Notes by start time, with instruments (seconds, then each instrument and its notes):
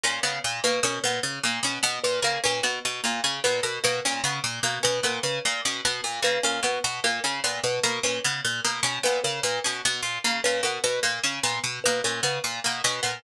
0.04 orchestral harp A#2, harpsichord C#4
0.23 orchestral harp C#3, harpsichord B3
0.44 orchestral harp A#2
0.64 orchestral harp B2, harpsichord A#3, kalimba B4
0.83 orchestral harp B2, harpsichord C#4, kalimba A#4
1.04 orchestral harp A#2, harpsichord B3, kalimba B4
1.23 orchestral harp C#3
1.43 orchestral harp A#2, harpsichord A#3
1.63 orchestral harp B2, harpsichord C#4
1.83 orchestral harp B2, harpsichord B3
2.04 orchestral harp A#2, kalimba B4
2.22 orchestral harp C#3, harpsichord A#3, kalimba A#4
2.44 orchestral harp A#2, harpsichord C#4, kalimba B4
2.63 orchestral harp B2, harpsichord B3
2.85 orchestral harp B2
3.04 orchestral harp A#2, harpsichord A#3
3.24 orchestral harp C#3, harpsichord C#4
3.44 orchestral harp A#2, harpsichord B3, kalimba B4
3.63 orchestral harp B2, kalimba A#4
3.84 orchestral harp B2, harpsichord A#3, kalimba B4
4.05 orchestral harp A#2, harpsichord C#4
4.24 orchestral harp C#3, harpsichord B3
4.44 orchestral harp A#2
4.63 orchestral harp B2, harpsichord A#3
4.83 orchestral harp B2, harpsichord C#4, kalimba B4
5.03 orchestral harp A#2, harpsichord B3, kalimba A#4
5.23 orchestral harp C#3, kalimba B4
5.45 orchestral harp A#2, harpsichord A#3
5.65 orchestral harp B2, harpsichord C#4
5.85 orchestral harp B2, harpsichord B3
6.04 orchestral harp A#2
6.22 orchestral harp C#3, harpsichord A#3, kalimba B4
6.43 orchestral harp A#2, harpsichord C#4, kalimba A#4
6.63 orchestral harp B2, harpsichord B3, kalimba B4
6.84 orchestral harp B2
7.04 orchestral harp A#2, harpsichord A#3
7.24 orchestral harp C#3, harpsichord C#4
7.44 orchestral harp A#2, harpsichord B3
7.64 orchestral harp B2, kalimba B4
7.83 orchestral harp B2, harpsichord A#3, kalimba A#4
8.03 orchestral harp A#2, harpsichord C#4, kalimba B4
8.24 orchestral harp C#3, harpsichord B3
8.45 orchestral harp A#2
8.65 orchestral harp B2, harpsichord A#3
8.83 orchestral harp B2, harpsichord C#4
9.03 orchestral harp A#2, harpsichord B3, kalimba B4
9.24 orchestral harp C#3, kalimba A#4
9.43 orchestral harp A#2, harpsichord A#3, kalimba B4
9.64 orchestral harp B2, harpsichord C#4
9.85 orchestral harp B2, harpsichord B3
10.03 orchestral harp A#2
10.24 orchestral harp C#3, harpsichord A#3
10.44 orchestral harp A#2, harpsichord C#4, kalimba B4
10.63 orchestral harp B2, harpsichord B3, kalimba A#4
10.84 orchestral harp B2, kalimba B4
11.03 orchestral harp A#2, harpsichord A#3
11.23 orchestral harp C#3, harpsichord C#4
11.43 orchestral harp A#2, harpsichord B3
11.64 orchestral harp B2
11.84 orchestral harp B2, harpsichord A#3, kalimba B4
12.04 orchestral harp A#2, harpsichord C#4, kalimba A#4
12.23 orchestral harp C#3, harpsichord B3, kalimba B4
12.44 orchestral harp A#2
12.64 orchestral harp B2, harpsichord A#3
12.84 orchestral harp B2, harpsichord C#4
13.03 orchestral harp A#2, harpsichord B3